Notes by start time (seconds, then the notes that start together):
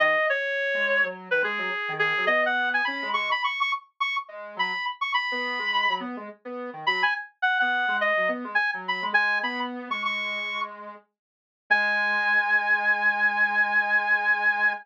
0.00 D#3 D#5
0.30 C#5
0.74 G#3
1.03 F#3
1.31 D#3 B4
1.42 G#3 G#4
1.58 F#3
1.88 D#3
1.99 G#4
2.17 F#3
2.27 B3 D#5
2.46 F#5
2.74 G#5
2.85 C#4 B5
3.02 G#3
3.14 G#3 C#6
3.31 B5
3.44 C#6
3.61 C#6
4.00 C#6
4.28 G#3
4.56 F#3 B5
5.01 C#6
5.14 B5
5.32 B3
5.59 G#3
5.89 F#3
6.00 B3
6.17 G#3
6.45 B3
6.73 D#3
6.87 F#3 B5
7.03 G#5
7.42 F#5
7.60 B3 F#5
7.88 G#3
8.01 D#5
8.17 F#3
8.28 B3
8.44 G#3
8.55 G#5
8.74 F#3
8.88 B5
9.02 G#3
9.13 G#3 G#5
9.43 B3 B5
9.90 G#3 C#6
10.05 C#6
11.70 G#3 G#5